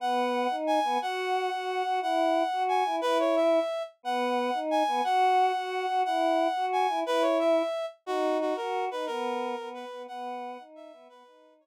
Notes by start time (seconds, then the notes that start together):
0.00 B3 F#5
0.50 D#4
0.67 G#5
0.84 B3
1.02 F#4 F#5
1.52 F#4
1.85 F#4
2.01 E4 F#5
2.52 F#4
2.69 G#5
2.86 E4
3.01 E4 B4
3.19 C#5
3.36 E5
4.03 B3 F#5
4.54 D#4
4.71 G#5
4.87 B3
5.04 F#4 F#5
5.55 F#4
5.88 F#4
6.05 E4 F#5
6.56 F#4
6.73 G#5
6.89 E4
7.05 E4 B4
7.22 C#5
7.39 E5
8.06 D#4 F#4
8.41 F#4
8.56 F#4 A#4
8.91 D#4 B4
9.06 B3 A#4
9.58 B3
9.74 B4
9.92 B3
10.08 B3 F#5
10.59 D#4
10.75 E5
10.92 B3
11.09 B3 B4
11.26 D#4
11.61 C#5